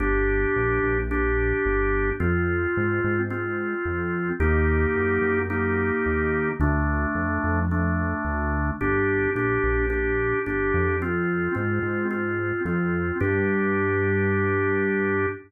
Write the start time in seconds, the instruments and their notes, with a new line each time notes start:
0.00 synth bass 1 G1, drawbar organ D4 G4
0.56 synth bass 1 A#1
0.83 synth bass 1 A#1
1.11 drawbar organ D4 G4
1.66 synth bass 1 G1
2.20 synth bass 1 F2, drawbar organ C4 F4
2.77 synth bass 1 G#2
3.04 synth bass 1 G#2
3.30 drawbar organ C4 F4
3.85 synth bass 1 F2
4.40 synth bass 1 D#2, drawbar organ A#3 D#4 G4
4.95 synth bass 1 F#2
5.21 synth bass 1 F#2
5.50 drawbar organ A#3 D#4 G4
6.06 synth bass 1 D#2
6.60 synth bass 1 D2, drawbar organ A3 D4
7.15 synth bass 1 F2
7.44 synth bass 1 F2
7.71 drawbar organ A3 D4
8.25 synth bass 1 D2
8.81 synth bass 1 G1, drawbar organ D4 G4
9.35 synth bass 1 A#1, drawbar organ D4 G4
9.64 synth bass 1 A#1
9.90 drawbar organ D4 G4
10.46 synth bass 1 G1, drawbar organ D4 G4
10.74 synth bass 1 F2
11.02 drawbar organ C4 F4
11.55 synth bass 1 G#2, drawbar organ C4 F4
11.82 synth bass 1 G#2
12.11 drawbar organ C4 F4
12.65 synth bass 1 F2, drawbar organ C4 F4
13.20 synth bass 1 G2, drawbar organ D4 G4